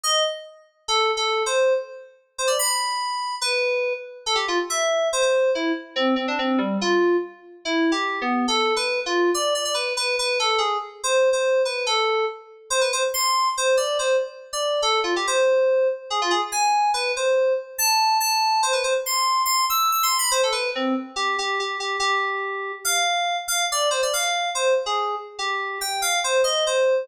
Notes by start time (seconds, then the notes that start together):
0.04 D#5
0.88 A4
1.17 A4
1.46 C5
2.38 C5
2.47 D5
2.59 B5
3.41 B4
4.26 A4
4.35 G4
4.48 F4
4.70 E5
5.13 C5
5.22 C5
5.55 E4
5.96 C4
6.16 C4
6.28 D4
6.39 C4
6.58 G3
6.81 F4
7.65 E4
7.92 G4
8.21 B3
8.48 A4
8.76 B4
9.06 F4
9.34 D5
9.55 D5
9.65 D5
9.74 B4
9.97 B4
10.19 B4
10.40 A4
10.58 G#4
11.04 C5
11.33 C5
11.65 B4
11.86 A4
12.70 C5
12.81 B4
12.93 C5
13.14 C6
13.57 C5
13.77 D5
13.99 C5
14.53 D5
14.82 A4
15.04 F4
15.16 G4
15.27 C5
16.10 G#4
16.22 F4
16.31 G#4
16.52 G#5
16.94 B4
17.16 C5
17.78 A5
18.20 A5
18.63 C5
18.73 B4
18.84 C5
19.06 C6
19.46 C6
19.70 E6
19.92 E6
20.03 C6
20.19 B5
20.31 C5
20.43 A4
20.52 B4
20.75 C4
21.16 G4
21.38 G4
21.60 G4
21.80 G4
22.00 G4
22.85 F5
23.48 F5
23.72 D5
23.91 C5
24.03 D5
24.13 F5
24.55 C5
24.86 G#4
25.39 G4
25.81 G5
26.02 F5
26.24 C5
26.44 D#5
26.67 C5